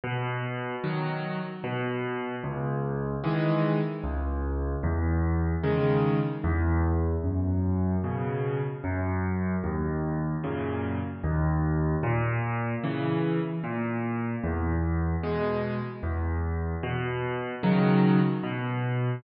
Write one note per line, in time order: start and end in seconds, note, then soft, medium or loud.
0.04 0.76 B2 loud
0.84 1.40 D#3 medium
0.84 1.40 F#3 medium
1.64 2.36 B2 loud
2.44 3.16 C#2 loud
3.24 3.80 D#3 medium
3.24 3.80 E3 medium
3.24 3.80 G#3 medium
4.04 4.75 C#2 loud
4.83 5.55 E2 loud
5.64 6.20 C#3 medium
5.64 6.20 D#3 medium
5.64 6.20 G#3 medium
6.44 7.16 E2 loud
7.24 7.96 F#2 loud
8.04 8.60 B2 medium
8.04 8.60 C#3 medium
8.84 9.56 F#2 loud
9.64 10.36 D#2 loud
10.44 11.00 F#2 medium
10.44 11.00 A#2 medium
10.44 11.00 C#3 medium
11.24 11.96 D#2 loud
12.03 12.75 A#2 loud
12.84 13.40 C#3 medium
12.84 13.40 E3 medium
13.64 14.36 A#2 medium
14.44 15.16 E2 loud
15.23 15.79 B2 medium
15.23 15.79 G#3 medium
16.03 16.75 E2 loud
16.83 17.55 B2 loud
17.63 18.19 C#3 medium
17.63 18.19 D#3 medium
17.63 18.19 F#3 medium
18.43 19.15 B2 loud